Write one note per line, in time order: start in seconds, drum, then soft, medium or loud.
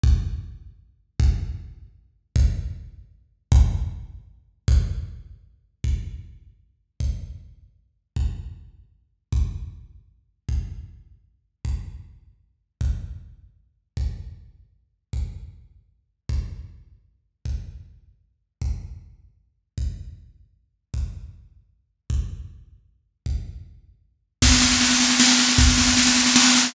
0.03 kick loud
1.20 kick loud
2.36 kick loud
3.52 kick loud
4.68 kick loud
5.84 kick medium
7.00 kick medium
8.16 kick medium
9.33 kick medium
10.49 kick medium
11.65 kick medium
12.81 kick medium
13.97 kick medium
15.13 kick medium
16.29 kick medium
17.45 kick medium
18.62 kick medium
19.78 kick medium
20.94 kick medium
22.10 kick medium
23.26 kick medium
24.42 kick loud
24.42 snare medium
24.52 snare medium
24.62 snare medium
24.71 snare medium
24.81 snare medium
24.91 snare medium
25.00 snare medium
25.10 snare medium
25.20 snare loud
25.29 snare medium
25.39 snare medium
25.49 snare medium
25.58 kick loud
25.58 snare medium
25.68 snare medium
25.78 snare medium
25.87 snare medium
25.97 snare medium
26.07 snare medium
26.16 snare medium
26.26 snare medium
26.36 snare loud
26.45 snare medium
26.55 snare medium
26.65 snare medium